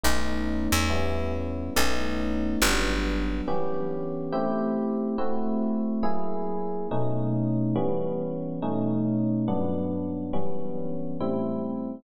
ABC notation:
X:1
M:4/4
L:1/8
Q:"Swing" 1/4=140
K:Em
V:1 name="Electric Piano 1"
[A,B,^C^D]4 [G,B,CE]4 | [A,B,^C^D]4 [F,G,B,=D]4 | [E,B,^CG]4 [A,=CEG]4 | [A,CEF]4 [F,^A,E^G]4 |
[B,,A,^C^D]4 [E,G,B,C]4 | [B,,A,^C^D]4 [G,,F,B,=D]4 | [E,G,B,^C]4 [A,,G,=CE]4 |]
V:2 name="Electric Bass (finger)" clef=bass
B,,,3 E,,5 | B,,,4 G,,,4 | z8 | z8 |
z8 | z8 | z8 |]